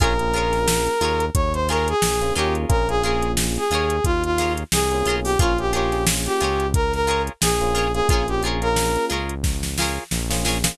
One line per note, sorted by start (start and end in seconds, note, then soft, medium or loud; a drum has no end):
0.00 0.88 A#1 medium
0.00 0.16 A#3 medium
0.00 0.16 C#4 medium
0.00 0.14 F4 medium
0.00 0.16 F4 medium
0.00 0.16 G#4 medium
0.00 0.14 G#4 medium
0.00 1.25 A#4 loud
0.00 0.14 A#4 medium
0.00 0.14 C#5 medium
0.00 kick loud
0.00 closed hi-hat loud
0.19 0.31 A#3 medium
0.19 0.31 C#4 medium
0.19 0.31 F4 medium
0.19 0.31 G#4 medium
0.19 closed hi-hat medium
0.34 0.89 A#3 medium
0.34 0.89 C#4 medium
0.34 0.89 F4 medium
0.34 0.59 F4 medium
0.34 0.89 G#4 medium
0.34 0.59 G#4 medium
0.34 0.59 A#4 medium
0.34 0.59 C#5 medium
0.34 closed hi-hat medium
0.53 snare medium
0.53 closed hi-hat medium
0.68 snare loud
0.87 closed hi-hat medium
1.01 1.30 D#2 medium
1.01 1.26 F4 medium
1.01 1.26 G#4 medium
1.01 1.26 A#4 medium
1.01 1.26 C#5 medium
1.01 closed hi-hat loud
1.20 closed hi-hat medium
1.34 1.94 D#2 medium
1.34 1.53 C#5 loud
1.34 kick loud
1.34 closed hi-hat loud
1.53 1.67 C5 medium
1.53 closed hi-hat medium
1.68 1.94 F4 medium
1.68 1.94 G#4 medium
1.68 1.88 A#4 loud
1.68 1.94 A#4 medium
1.68 1.94 C#5 medium
1.68 snare soft
1.68 closed hi-hat loud
1.88 2.33 G#4 loud
1.88 closed hi-hat medium
2.02 2.32 A#1 medium
2.02 snare loud
2.21 2.33 A#3 medium
2.21 2.33 C#4 medium
2.21 2.33 F4 medium
2.21 2.33 G#4 medium
2.21 closed hi-hat medium
2.35 2.66 D#2 medium
2.35 2.64 A#3 medium
2.35 2.64 C#4 medium
2.35 2.82 F4 medium
2.35 2.64 F4 medium
2.35 2.54 G4 medium
2.35 2.64 G#4 medium
2.35 2.82 G#4 medium
2.35 2.82 A#4 medium
2.35 2.82 C#5 medium
2.35 closed hi-hat medium
2.55 closed hi-hat medium
2.69 3.58 A#1 medium
2.69 2.85 A#3 medium
2.69 2.85 C#4 medium
2.69 2.85 F4 medium
2.69 2.85 G#4 medium
2.69 2.87 A#4 loud
2.69 kick loud
2.69 closed hi-hat loud
2.89 3.00 A#3 medium
2.89 3.00 C#4 medium
2.89 3.00 F4 medium
2.89 3.00 G#4 medium
2.89 3.02 G#4 loud
2.89 closed hi-hat medium
3.03 3.59 A#3 medium
3.03 3.59 C#4 medium
3.03 3.28 F4 medium
3.03 3.59 F4 medium
3.03 3.32 G#4 medium
3.03 3.59 G#4 medium
3.03 3.28 G#4 medium
3.03 3.28 A#4 medium
3.03 closed hi-hat medium
3.07 3.28 C#5 medium
3.22 closed hi-hat medium
3.37 snare loud
3.56 4.04 G#4 medium
3.56 closed hi-hat medium
3.71 4.00 D#2 medium
3.71 3.96 F4 medium
3.71 3.96 G#4 medium
3.71 3.96 A#4 medium
3.71 3.96 C#5 medium
3.71 closed hi-hat medium
3.90 closed hi-hat medium
4.04 4.64 D#2 medium
4.04 4.23 F4 loud
4.04 kick loud
4.04 closed hi-hat loud
4.24 4.53 F4 loud
4.24 closed hi-hat medium
4.38 4.63 F4 medium
4.38 4.63 G#4 medium
4.38 4.63 A#4 medium
4.38 4.63 C#5 medium
4.38 snare medium
4.38 closed hi-hat loud
4.57 closed hi-hat medium
4.72 5.03 C2 medium
4.72 5.15 G#4 loud
4.72 snare loud
4.91 5.04 A#3 medium
4.91 5.04 C#4 medium
4.91 5.04 F4 medium
4.91 5.04 G#4 medium
4.91 closed hi-hat medium
5.05 5.37 B1 medium
5.05 5.33 A#3 medium
5.05 5.33 C#4 medium
5.05 5.33 F4 medium
5.05 5.20 F4 medium
5.05 5.33 G#4 medium
5.05 5.20 G#4 medium
5.05 5.20 A#4 medium
5.05 closed hi-hat loud
5.10 5.20 C#5 medium
5.24 5.38 G4 loud
5.24 open hi-hat medium
5.39 6.28 A#1 medium
5.39 5.54 A#3 medium
5.39 5.54 C#4 medium
5.39 5.54 F4 medium
5.39 5.58 F4 loud
5.39 5.53 F4 medium
5.39 5.54 G#4 medium
5.39 5.53 G#4 medium
5.39 5.53 A#4 medium
5.39 5.53 C#5 medium
5.39 kick loud
5.39 closed hi-hat loud
5.58 5.70 A#3 medium
5.58 5.70 C#4 medium
5.58 5.70 F4 medium
5.58 5.72 G4 loud
5.58 5.70 G#4 medium
5.58 closed hi-hat medium
5.72 5.88 A#3 medium
5.72 5.88 C#4 medium
5.72 5.88 F4 medium
5.72 5.98 F4 medium
5.72 6.04 G4 loud
5.72 5.88 G#4 medium
5.72 5.98 G#4 medium
5.72 5.98 A#4 medium
5.72 closed hi-hat loud
5.76 5.98 C#5 medium
5.92 6.44 A#3 medium
5.92 6.44 C#4 medium
5.92 6.44 F4 medium
5.92 6.44 G#4 medium
5.92 snare soft
5.92 closed hi-hat medium
6.07 snare loud
6.26 6.67 G4 loud
6.26 closed hi-hat medium
6.40 7.29 C#2 medium
6.40 6.66 F4 medium
6.40 6.66 G#4 medium
6.40 6.66 A#4 medium
6.40 6.66 C#5 medium
6.40 closed hi-hat loud
6.60 closed hi-hat medium
6.74 6.92 A#4 loud
6.74 kick loud
6.74 closed hi-hat loud
6.93 7.22 A#4 loud
6.93 snare soft
6.93 closed hi-hat medium
7.07 7.32 F4 medium
7.07 7.32 G#4 medium
7.07 7.32 A#4 medium
7.07 7.32 C#5 medium
7.07 closed hi-hat medium
7.27 closed hi-hat medium
7.42 8.02 A#1 medium
7.42 7.91 G#4 loud
7.42 snare loud
7.61 7.87 A#3 medium
7.61 7.87 C#4 medium
7.61 7.87 F4 medium
7.61 7.87 G#4 medium
7.61 closed hi-hat medium
7.74 7.88 F4 medium
7.74 7.88 G#4 medium
7.74 7.88 A#4 medium
7.74 7.88 C#5 medium
7.74 snare soft
7.74 closed hi-hat medium
7.94 8.06 A#3 medium
7.94 8.06 C#4 medium
7.94 8.06 F4 medium
7.94 8.07 G#4 loud
7.94 8.06 G#4 medium
7.94 closed hi-hat medium
8.08 8.97 A#1 medium
8.08 8.24 A#3 medium
8.08 8.24 C#4 medium
8.08 8.24 F4 loud
8.08 8.23 F4 medium
8.08 8.27 G#4 loud
8.08 8.24 G#4 medium
8.08 8.23 G#4 medium
8.08 8.23 A#4 medium
8.08 kick loud
8.08 closed hi-hat loud
8.13 8.23 C#5 medium
8.28 8.40 A#3 medium
8.28 8.40 C#4 medium
8.28 8.40 F4 medium
8.28 8.42 G4 loud
8.28 8.40 G#4 medium
8.28 closed hi-hat medium
8.43 8.58 A#3 medium
8.43 8.58 C#4 medium
8.43 8.58 F4 medium
8.43 8.69 F4 medium
8.43 8.58 G#4 medium
8.43 8.69 G#4 medium
8.43 8.69 A#4 medium
8.43 closed hi-hat medium
8.47 8.69 C#5 medium
8.62 9.14 A#3 medium
8.62 9.14 C#4 medium
8.62 9.14 F4 medium
8.62 9.14 G#4 medium
8.62 9.05 A#4 loud
8.62 closed hi-hat medium
8.76 snare loud
8.96 closed hi-hat medium
9.09 9.99 C#2 medium
9.09 9.34 F4 medium
9.09 9.34 G#4 medium
9.09 9.34 A#4 medium
9.09 9.34 C#5 medium
9.09 closed hi-hat medium
9.29 closed hi-hat medium
9.44 kick medium
9.44 snare medium
9.63 snare medium
9.78 10.04 F4 medium
9.78 10.04 G#4 medium
9.78 10.04 A#4 medium
9.78 snare loud
9.82 10.04 C#5 medium
10.11 10.71 A#1 medium
10.11 snare medium
10.30 10.56 A#3 medium
10.30 10.56 C#4 medium
10.30 10.56 F4 medium
10.30 10.56 G#4 medium
10.30 snare loud
10.45 10.58 F4 medium
10.45 10.58 G#4 medium
10.45 10.58 A#4 medium
10.45 10.58 C#5 medium
10.45 snare medium
10.64 10.75 A#3 medium
10.64 10.75 C#4 medium
10.64 10.75 F4 medium
10.64 10.75 G#4 medium
10.64 snare loud